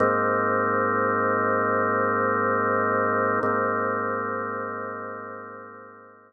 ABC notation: X:1
M:4/4
L:1/8
Q:1/4=70
K:Ablyd
V:1 name="Drawbar Organ"
[A,,B,CE]8 | [A,,B,CE]8 |]